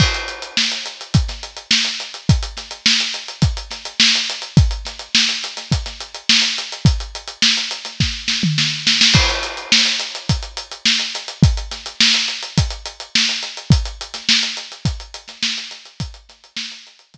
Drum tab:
CC |x---------------|----------------|----------------|----------------|
HH |-xxx-xxxxxxx-xxx|xxxx-xxxxxxx-xxx|xxxx-xxxxxxx-xxx|xxxx-xxx--------|
SD |----o----o--o---|--o-o-----o-o---|--o-o--o-o--o---|----o--oo-o-o-oo|
T2 |----------------|----------------|----------------|-----------o----|
BD |o-------o-------|o-------o-------|o-------o-------|o-------o-------|

CC |x---------------|----------------|----------------|----------------|
HH |-xxx-xxxxxxx-xxx|xxxx-xxxxxxx-xxx|xxxx-xxxxxxx-xxx|xxxx-xxxx-------|
SD |----o-------o---|--o-o-------o---|---ooo-----oo-o-|--o-o-----------|
T2 |----------------|----------------|----------------|----------------|
BD |o-------o-------|o-------o-------|o-------o-------|o-------o-------|